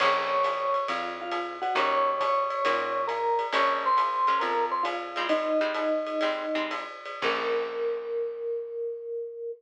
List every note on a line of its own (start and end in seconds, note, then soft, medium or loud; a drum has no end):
0.00 0.78 A#1 loud
0.00 0.36 A#3 medium
0.00 0.36 C#4 medium
0.00 0.36 F4 medium
0.00 0.36 G#4 loud
0.00 0.87 C#5 medium
0.00 0.87 C#6 loud
0.00 kick medium
0.00 crash loud
0.00 ride loud
0.44 hi-hat pedal loud
0.44 ride loud
0.74 ride medium
0.88 1.66 F2 medium
0.88 1.16 F4 medium
0.88 1.16 F5 medium
0.88 ride loud
1.21 1.54 F4 medium
1.21 1.54 F5 medium
1.32 hi-hat pedal medium
1.32 ride loud
1.62 1.74 F#4 medium
1.62 1.74 F#5 medium
1.62 ride medium
1.75 2.52 D#2 loud
1.75 2.11 A#3 loud
1.75 2.11 C#4 medium
1.75 2.11 D#4 medium
1.75 2.11 F#4 medium
1.75 2.19 C#5 loud
1.75 2.19 C#6 loud
1.75 ride loud
2.20 3.03 C#5 medium
2.20 3.03 C#6 medium
2.20 kick medium
2.20 hi-hat pedal loud
2.20 ride loud
2.50 ride medium
2.65 3.43 A#2 medium
2.65 3.01 A#3 medium
2.65 3.01 C#4 medium
2.65 3.01 D#4 medium
2.65 3.01 F#4 medium
2.65 ride loud
3.07 3.46 A#4 medium
3.07 3.46 A#5 medium
3.07 hi-hat pedal loud
3.07 ride loud
3.39 ride medium
3.52 4.31 A#1 loud
3.52 3.88 G#3 medium
3.52 3.88 A#3 medium
3.52 3.88 C#4 medium
3.52 3.88 F4 medium
3.52 3.81 C#5 medium
3.52 3.81 C#6 loud
3.52 ride loud
3.86 4.42 C5 medium
3.86 4.42 C6 medium
3.97 hi-hat pedal loud
3.97 ride loud
4.27 4.54 G#3 medium
4.27 4.54 A#3 medium
4.27 4.54 C#4 medium
4.27 4.54 F4 medium
4.27 ride medium
4.40 5.19 F2 medium
4.40 4.65 A#4 medium
4.40 4.65 A#5 medium
4.40 ride loud
4.72 4.83 C5 medium
4.72 4.83 C6 medium
4.83 5.23 F4 medium
4.83 5.23 F5 medium
4.83 hi-hat pedal loud
4.83 ride loud
5.16 5.52 G3 loud
5.16 5.52 G#3 medium
5.16 5.52 C4 loud
5.16 5.52 D#4 medium
5.16 ride loud
5.29 6.73 D#4 medium
5.29 6.73 D#5 loud
5.29 ride loud
5.61 5.88 G3 medium
5.61 5.88 G#3 medium
5.61 5.88 C4 medium
5.61 5.88 D#4 medium
5.74 hi-hat pedal loud
5.74 ride loud
6.07 ride medium
6.21 6.46 G3 medium
6.21 6.46 G#3 medium
6.21 6.46 C4 medium
6.21 6.46 D#4 medium
6.21 ride loud
6.55 6.85 G3 medium
6.55 6.85 G#3 medium
6.55 6.85 C4 medium
6.55 6.85 D#4 medium
6.71 hi-hat pedal medium
6.71 ride loud
7.05 ride medium
7.22 9.50 A#1 loud
7.22 9.49 A#3 medium
7.22 9.49 C#4 medium
7.22 9.49 F4 medium
7.22 9.49 G#4 loud
7.22 9.51 A#4 loud
7.22 kick loud
7.22 crash loud